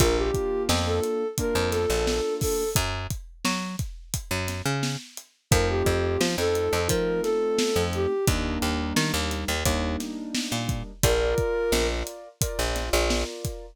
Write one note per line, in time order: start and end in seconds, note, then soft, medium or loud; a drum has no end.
0.00 0.31 A#1 medium
0.00 1.24 A#3 loud
0.00 1.24 D4 loud
0.00 1.24 F4 loud
0.00 0.17 A#4 loud
0.00 kick loud
0.00 closed hi-hat loud
0.16 0.63 G4 medium
0.34 kick medium
0.34 closed hi-hat medium
0.69 1.00 F2 medium
0.69 snare loud
0.85 1.27 A4 medium
1.03 closed hi-hat medium
1.38 2.63 A#3 loud
1.38 2.63 D4 loud
1.38 2.63 F4 medium
1.38 1.69 A#4 medium
1.38 kick medium
1.38 closed hi-hat loud
1.55 1.86 F2 medium
1.71 2.34 A4 medium
1.71 snare medium
1.71 closed hi-hat medium
1.90 2.21 A#1 medium
2.07 snare loud
2.41 2.70 A4 medium
2.41 kick medium
2.41 open hi-hat medium
2.76 3.07 F#2 medium
2.76 kick loud
2.76 closed hi-hat loud
3.10 kick medium
3.10 closed hi-hat medium
3.45 3.76 F#3 medium
3.45 snare loud
3.79 kick medium
3.79 closed hi-hat medium
4.14 kick medium
4.14 closed hi-hat loud
4.31 4.62 F#2 medium
4.48 snare medium
4.48 closed hi-hat medium
4.66 4.97 C#3 medium
4.83 snare medium
5.17 closed hi-hat medium
5.51 5.83 F2 loud
5.51 6.76 A3 loud
5.51 6.76 C4 loud
5.51 6.76 D#4 loud
5.51 6.76 F4 loud
5.51 5.67 A#4 loud
5.51 kick loud
5.51 closed hi-hat loud
5.69 6.20 G4 medium
5.86 6.17 F2 medium
5.86 kick medium
5.86 closed hi-hat medium
6.21 6.36 F3 medium
6.21 snare loud
6.38 6.69 F2 medium
6.38 6.80 A4 loud
6.55 closed hi-hat medium
6.73 6.88 F2 medium
6.88 7.21 F3 medium
6.88 8.12 A3 medium
6.88 8.12 C4 loud
6.88 8.12 D#4 loud
6.88 8.12 F4 medium
6.88 7.21 A#4 medium
6.88 kick medium
6.88 closed hi-hat loud
7.22 7.83 A4 loud
7.22 snare medium
7.22 closed hi-hat medium
7.58 snare loud
7.76 8.07 F2 medium
7.93 8.25 G4 medium
7.93 closed hi-hat medium
8.27 8.58 D#2 medium
8.27 9.52 G3 loud
8.27 9.52 A#3 loud
8.27 9.52 D4 loud
8.27 9.52 D#4 loud
8.27 kick loud
8.27 closed hi-hat loud
8.62 8.93 D#2 medium
8.62 closed hi-hat medium
8.96 9.12 D#3 medium
8.96 snare loud
9.14 9.45 D#2 medium
9.31 snare soft
9.31 closed hi-hat medium
9.48 9.64 D#2 medium
9.65 9.97 D#2 medium
9.65 10.91 G3 medium
9.65 10.91 A#3 loud
9.65 10.91 D4 medium
9.65 10.91 D#4 medium
9.65 kick medium
9.65 closed hi-hat loud
10.00 snare medium
10.00 closed hi-hat medium
10.35 snare loud
10.52 10.83 A#2 medium
10.69 kick medium
10.69 closed hi-hat medium
11.03 11.35 A#1 medium
11.03 12.28 F4 loud
11.03 11.87 A#4 loud
11.03 12.28 A#4 loud
11.03 12.28 D5 loud
11.03 kick loud
11.03 closed hi-hat loud
11.38 kick medium
11.38 closed hi-hat medium
11.72 12.03 A#1 medium
11.72 snare loud
12.07 closed hi-hat medium
12.41 13.66 F4 loud
12.41 13.66 A#4 loud
12.41 13.66 D5 medium
12.41 kick medium
12.41 closed hi-hat loud
12.59 12.90 A#1 medium
12.76 snare medium
12.76 closed hi-hat medium
12.93 13.24 A#1 loud
13.10 snare loud
13.45 kick medium
13.45 closed hi-hat medium